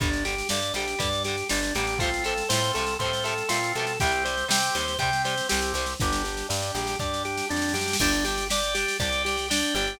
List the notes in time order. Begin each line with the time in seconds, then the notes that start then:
0.00 G1 D3 G3 D4 G4, kick, snare
0.13 snare
0.25 D3 G3 G4, snare
0.38 snare
0.49 G2 D3 G3 D4 G4 D5, snare
0.62 snare
0.74 A#1 D3 G3 G4, snare
0.88 snare
0.99 G2 D3 G3 D4 G4 D5, kick, snare
1.13 snare
1.24 D3 G3 G4, snare
1.38 snare
1.49 G1 D3 G3 D4 G4, snare
1.63 snare
1.75 A1 D3 G3 G4, snare
1.87 snare
1.99 F3 A3 C4 F4 A4, kick, snare
2.04 C3
2.14 snare
2.24 C3 F3 A3 A4, snare
2.38 snare
2.49 A2 F3 A3 C4 F4 A4 C5, snare
2.54 C3
2.64 snare
2.74 C2 F3 A3 A4, snare
2.79 C3
2.87 snare
2.99 A2 A3 C4 F4 A4 C5, kick, snare
3.03 C3 F3
3.13 snare
3.24 C3 F3 A3 A4, snare
3.38 snare
3.48 A#2 F3 A3 C4 F4 A4, snare
3.53 C3
3.64 snare
3.75 B2 F3 A3 A4, snare
3.79 C3
3.87 snare
4.00 C2 C3 G3 C4 G4, kick, snare
4.12 snare
4.24 C3 G3 C5, snare
4.37 snare
4.48 C3 G3 C4 G4 G5, snare
4.62 snare
4.75 D#2 C3 G3 C5, snare
4.88 snare
4.99 C3 G3 C4 G4 G5, kick, snare
5.13 snare
5.24 C3 G3 C5, snare
5.38 snare
5.49 C2 C3 G3 C4 G4, snare
5.62 snare
5.74 C2 C3 G3 C5, snare
5.86 snare
5.99 G1 D4 G4, kick, snare
6.12 snare
6.24 G4, snare
6.37 snare
6.49 G2 D4 G4 D5, snare
6.62 snare
6.75 A#1 G4, snare
6.87 snare
6.99 G2 D4 G4 D5, kick, snare
7.14 snare
7.25 G4, snare
7.38 snare
7.49 F2 D4 G4, snare
7.56 snare
7.62 snare
7.69 snare
7.74 F#2 G4, snare
7.81 snare
7.88 snare
7.93 snare
7.99 G1 D4 G4 D5 G5, kick, snare, crash
8.12 snare
8.24 D4 G4, snare
8.38 snare
8.50 D4 G4 D5 G5, snare
8.63 snare
8.74 D4 G4, snare
8.88 snare
9.00 C2 D4 G4 D5 G5, kick, snare
9.12 snare
9.25 D4 G4, snare
9.37 snare
9.48 D4 G4 D5 G5, snare
9.63 snare
9.75 G1 D4 G4, snare
9.87 snare